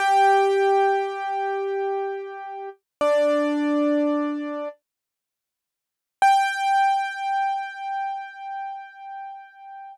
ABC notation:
X:1
M:4/4
L:1/8
Q:1/4=80
K:Gm
V:1 name="Acoustic Grand Piano"
[Gg]8 | "^rit." [Dd]5 z3 | g8 |]